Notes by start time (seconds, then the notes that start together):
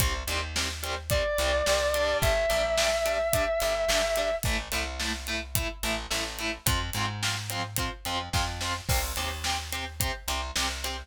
0.00 C2 G3 C4, kick, closed hi-hat
0.27 D#2 G3 C4, closed hi-hat
0.56 G3 C4, snare
0.83 G3 C4, closed hi-hat
1.10 G3 C4 D5, kick, closed hi-hat
1.38 C2 G3 C4, closed hi-hat
1.66 C2 G3 C4, snare
1.94 G3 D4, closed hi-hat
2.22 G1 E5, kick, closed hi-hat
2.50 A#1 G3 D4, closed hi-hat
2.78 G3 D4, snare
3.05 G3 D4, closed hi-hat
3.33 G3 D4, kick, closed hi-hat
3.60 G1 G3 D4, closed hi-hat
3.88 G1 G3 D4, snare
4.16 G3 D4, closed hi-hat
4.43 A1 A3 E4, kick, closed hi-hat
4.72 C2 A3 E4, closed hi-hat
5.00 A3 E4, snare
5.27 A3 E4, closed hi-hat
5.55 A3 E4, kick, closed hi-hat
5.83 A1 A3 E4, closed hi-hat
6.11 A1 A3 E4, snare
6.39 A3 E4, closed hi-hat
6.66 F2 C4 F4, kick, closed hi-hat
6.93 G#2 C4 F4, closed hi-hat
7.23 C4 F4, snare
7.50 C4 F4, closed hi-hat
7.76 C4 F4, kick, closed hi-hat
8.05 F2 C4 F4, closed hi-hat
8.33 F2 C4 F4, kick, snare
8.61 C4 F4, snare
8.89 C2 C4 G4, kick, crash
9.16 D#2 C4 G4, closed hi-hat
9.44 C4 G4, snare
9.72 C4 G4, closed hi-hat
10.00 C4 G4, kick, closed hi-hat
10.28 C2 C4 G4, closed hi-hat
10.56 C2 C4 G4, snare
10.84 C4 G4, closed hi-hat